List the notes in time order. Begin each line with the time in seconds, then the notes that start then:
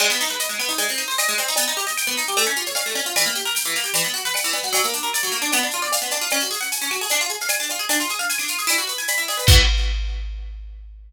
0.00 G#3, crash, cowbell, claves
0.10 B3, shaker
0.20 D#4, shaker
0.28 B4, snare, shaker
0.39 D#5, shaker
0.49 G#3, shaker
0.59 B3, claves, shaker
0.69 D#4, shaker
0.78 G#3, cowbell, shaker
0.88 C4, snare, shaker
0.97 D#4, shaker
1.08 C5, shaker
1.18 D#5, cowbell, claves, shaker
1.28 G#3, shaker
1.38 C4, cowbell, shaker
1.47 D#4, snare, shaker
1.56 B3, cowbell, shaker
1.68 D#4, shaker
1.77 G4, shaker
1.87 D#5, shaker
1.98 G5, claves, shaker
2.07 B3, snare, shaker
2.17 D#4, shaker
2.26 G4, snare, shaker
2.37 A3, cowbell, claves, shaker
2.45 C#4, shaker
2.56 F4, shaker
2.66 C#5, shaker
2.75 F5, cowbell, shaker
2.86 A3, shaker
2.95 C#4, cowbell, shaker
3.06 F4, shaker
3.16 E3, cowbell, claves, shaker
3.26 A#3, shaker
3.35 G4, shaker
3.45 A#4, shaker
3.55 G5, shaker
3.64 E3, shaker
3.74 A#3, claves, shaker
3.84 G4, shaker
3.94 E3, cowbell, shaker
4.04 B3, snare, shaker
4.14 F#4, shaker
4.25 B4, shaker
4.34 F#5, cowbell, claves, shaker
4.44 E3, shaker
4.53 B3, cowbell, shaker
4.63 F#4, snare, shaker
4.73 F#3, cowbell, shaker
4.84 A#3, shaker
4.93 D4, shaker
5.03 A#4, shaker
5.13 D5, claves, shaker
5.23 F#3, shaker
5.32 A#3, shaker
5.42 D4, snare, shaker
5.52 B3, cowbell, claves, shaker
5.63 D4, shaker
5.71 F4, snare, shaker
5.82 D5, shaker
5.92 F5, cowbell, shaker
6.01 B3, shaker
6.11 D4, cowbell, shaker
6.21 F4, shaker
6.30 C#4, cowbell, claves, shaker
6.40 F#4, shaker
6.51 G#4, shaker
6.61 F#5, shaker
6.72 G#5, shaker
6.82 C#4, shaker
6.91 F#4, claves, shaker
7.01 G#4, shaker
7.09 D4, cowbell, shaker
7.20 F4, shaker
7.29 G#4, shaker
7.40 F5, shaker
7.48 G#5, cowbell, claves, shaker
7.60 D4, shaker
7.69 F4, cowbell, shaker
7.79 G#4, shaker
7.89 D4, cowbell, shaker
8.00 F4, shaker
8.09 G#4, shaker
8.19 F5, shaker
8.29 G#5, shaker
8.38 D4, claves, shaker
8.48 F4, shaker
8.59 G#4, shaker
8.67 E4, cowbell, claves, shaker
8.78 F#4, shaker
8.87 B4, shaker
8.98 G#5, shaker
9.08 B5, cowbell, shaker
9.18 E4, shaker
9.28 G#4, cowbell, shaker
9.37 B4, cowbell, shaker
9.47 E3 B3 F#4, kick, crash